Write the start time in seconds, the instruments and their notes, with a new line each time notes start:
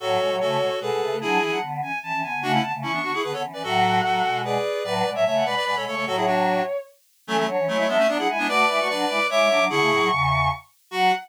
0.00 choir aahs A2 F#3, clarinet F#4 A4, violin C#5
0.21 choir aahs B2 G#3
0.31 choir aahs A2 F#3
0.40 choir aahs C#3 A3, clarinet F#4 A4
0.60 choir aahs B2 G#3
0.80 choir aahs B2 G#3, clarinet G#4 B4, violin A4
0.91 choir aahs B2 G#3
1.01 choir aahs C#3 A3
1.12 choir aahs C#3 A3
1.21 choir aahs F#3 D4, clarinet E4 G#4, violin G#5
1.41 choir aahs E3 C#4, violin G#5
1.51 choir aahs F#3 D4, violin F#5
1.62 choir aahs D3 B3
1.82 choir aahs E3 C#4, violin G#5
2.03 choir aahs E3 C#4, violin A5
2.13 choir aahs E3 C#4
2.22 choir aahs D3 B3, violin G#5
2.33 choir aahs D3 B3
2.42 choir aahs C#3 A3, clarinet D4 F#4, violin F#5
2.53 clarinet C#4 E4
2.62 choir aahs D3 B3, violin A5
2.74 choir aahs C#3 A3
2.82 choir aahs E3 C#4, clarinet C#4 E4, violin C#6
2.92 clarinet B3 D4
3.03 choir aahs D3 B3, clarinet D4 F#4
3.14 clarinet E4 G#4
3.23 choir aahs D3 B3, clarinet G#4 B4
3.33 choir aahs D3 B3, clarinet A4 C#5
3.43 choir aahs E3 C#4
3.53 choir aahs E3 C#4, clarinet B4 D5
3.63 choir aahs A2 F#3, clarinet F#4 A4, violin F#5
4.03 choir aahs A2 F#3, clarinet F#4 A4
4.24 choir aahs B2 G#3
4.44 clarinet G#4 B4, violin D5
4.84 choir aahs A2 F#3, violin B4, clarinet B4 D5
4.95 violin B4
5.05 choir aahs B2 G#3, violin D5
5.15 choir aahs A2 F#3, clarinet C#5 E5, violin E5
5.25 choir aahs C#3 A3, clarinet C#5 E5, violin E5
5.36 violin F#5
5.45 choir aahs B2 G#3, clarinet B4 D5, violin B5
5.56 clarinet B4 D5
5.65 choir aahs B2 G#3, clarinet B4 D5
5.76 choir aahs B2 G#3, clarinet A4 C#5
5.86 choir aahs C#3 A3, clarinet A4 C#5, violin C#6
5.95 choir aahs C#3 A3, clarinet A4 C#5
6.06 choir aahs A2 F#3, clarinet F#4 A4, violin C#5
6.15 clarinet E4 G#4, violin C#5
6.26 clarinet D4 F#4
7.27 choir aahs E3 C#4, clarinet F#3 A3, violin A4
7.37 clarinet F#3 A3
7.47 choir aahs F#3 D4, violin C#5
7.59 choir aahs E3 C#4
7.68 clarinet F#3 A3, choir aahs G#3 E4, violin C#5
7.78 clarinet F#3 A3
7.88 choir aahs F#3 D4, clarinet G#3 B3, violin E5
7.98 clarinet A3 C#4
8.08 choir aahs F#3 D4, clarinet B3 D4, violin D5
8.18 choir aahs F#3 D4, clarinet E4 G#4, violin F#5
8.28 choir aahs G#3 E4, violin G#5
8.38 choir aahs G#3 E4, clarinet B3 D4
8.48 choir aahs A3 F#4, clarinet B4 D5, violin D6
8.69 choir aahs G#3 E4, violin D6
8.79 choir aahs A3 F#4, violin C#6
8.89 choir aahs F#3 D4, clarinet B4 D5
9.09 choir aahs G#3 E4, violin D6
9.30 choir aahs G#3 E4, clarinet C#5 E5, violin D6
9.39 choir aahs G#3 E4
9.49 choir aahs F#3 D4, violin D6
9.59 choir aahs F#3 D4
9.70 choir aahs D3 B3, clarinet E4 G#4, violin C#6
9.80 choir aahs C#3 A3
9.91 choir aahs A2 F#3
10.00 choir aahs A2 F#3
10.11 choir aahs E2 C#3
10.91 choir aahs F#3, clarinet F#4, violin F#5